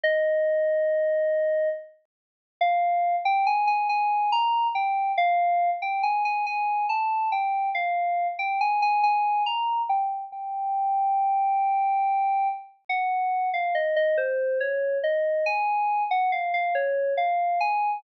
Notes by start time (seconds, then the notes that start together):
0.04 D#5
2.61 F5
3.25 G5
3.47 G#5
3.67 G#5
3.89 G#5
4.32 A#5
4.75 G5
5.18 F5
5.82 G5
6.03 G#5
6.25 G#5
6.46 G#5
6.89 A5
7.32 G5
7.75 F5
8.39 G5
8.61 G#5
8.82 G#5
9.03 G#5
9.46 A#5
9.89 G5
10.32 G5
12.89 F#5
13.54 F5
13.75 D#5
13.96 D#5
14.18 C5
14.61 C#5
15.04 D#5
15.46 G#5
16.11 F#5
16.32 F5
16.54 F5
16.75 C#5
17.18 F5
17.61 G#5